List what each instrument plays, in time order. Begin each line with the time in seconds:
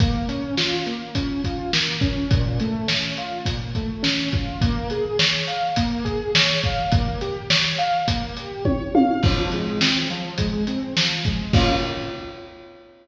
0.00 acoustic grand piano A#3, kick, closed hi-hat
0.29 acoustic grand piano C#4, closed hi-hat
0.57 acoustic grand piano F4, snare
0.86 acoustic grand piano A#3, closed hi-hat
1.15 acoustic grand piano C#4, kick, closed hi-hat
1.44 acoustic grand piano F4, kick, closed hi-hat
1.73 acoustic grand piano A#3, snare
2.01 acoustic grand piano C#4, kick, closed hi-hat
2.31 acoustic grand piano A#2, kick, closed hi-hat
2.60 acoustic grand piano A3, closed hi-hat
2.88 acoustic grand piano C#4, snare
3.17 acoustic grand piano F4, closed hi-hat
3.45 acoustic grand piano A#2, kick, closed hi-hat
3.75 acoustic grand piano A3, kick, closed hi-hat
4.03 acoustic grand piano C#4, snare
4.32 acoustic grand piano F4, kick, closed hi-hat
4.61 acoustic grand piano A#3, kick, closed hi-hat
4.90 acoustic grand piano G#4, closed hi-hat
5.19 acoustic grand piano C#5, snare
5.47 acoustic grand piano F5, closed hi-hat
5.76 acoustic grand piano A#3, kick, closed hi-hat
6.05 acoustic grand piano G#4, kick, closed hi-hat
6.35 acoustic grand piano C#5, snare
6.63 acoustic grand piano F5, kick, closed hi-hat
6.92 acoustic grand piano A#3, kick, closed hi-hat
7.21 acoustic grand piano G4, closed hi-hat
7.50 acoustic grand piano C#5, snare
7.78 acoustic grand piano F5, closed hi-hat
8.08 acoustic grand piano A#3, kick, closed hi-hat
8.37 acoustic grand piano G4, closed hi-hat
8.65 acoustic grand piano C#5, kick, high tom
8.95 acoustic grand piano F5, high tom
9.23 acoustic grand piano F3, kick, crash
9.52 acoustic grand piano G#3, closed hi-hat
9.81 acoustic grand piano C4, snare
10.10 acoustic grand piano F3, closed hi-hat
10.38 acoustic grand piano G#3, kick, closed hi-hat
10.67 acoustic grand piano C4, closed hi-hat
10.97 acoustic grand piano F3, snare
11.25 acoustic grand piano G#3, kick, closed hi-hat
11.53 acoustic grand piano A#3 C#4 F4, kick, crash